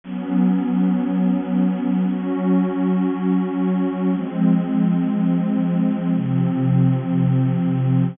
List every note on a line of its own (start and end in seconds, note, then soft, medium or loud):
0.04 2.05 F#3 medium
0.04 2.05 B3 medium
0.04 2.05 C#4 medium
2.08 4.09 F#3 medium
2.08 4.09 C#4 medium
2.08 4.09 F#4 medium
4.10 6.12 F3 medium
4.10 6.12 G#3 medium
4.10 6.12 C4 medium
6.14 8.16 C3 medium
6.14 8.16 F3 medium
6.14 8.16 C4 medium